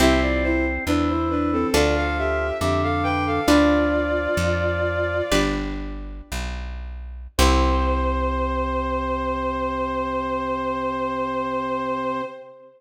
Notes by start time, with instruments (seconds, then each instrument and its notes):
0.00 electric bass (finger) C2, drawbar organ C4, acoustic guitar (steel) C4 E4 G4, violin G4 E5
0.22 violin F4 D5
0.43 violin E4 C5
0.86 electric bass (finger) E2, drawbar organ E3, violin D4 B4
1.08 violin E4 C5
1.30 violin D4 B4
1.52 violin C4 A4
1.73 electric bass (finger) D2, drawbar organ F3, acoustic guitar (steel) D4 F4 A4, violin F4 D5
1.96 violin A4 F5
2.18 violin G4 E5
2.61 electric bass (finger) F2, drawbar organ D3, violin G4 E5
2.83 violin A4 F5
3.03 violin B4 G5
3.26 violin A4 F5
3.47 electric bass (finger) D2, drawbar organ F3, acoustic guitar (steel) D4 F4 B4, violin F4 D5
4.37 electric bass (finger) F2
5.31 electric bass (finger) G1, acoustic guitar (steel) D4 G4 B4
6.32 electric bass (finger) B1
7.38 electric bass (finger) C2, drawbar organ C3, acoustic guitar (steel) C4 E4 G4, violin C5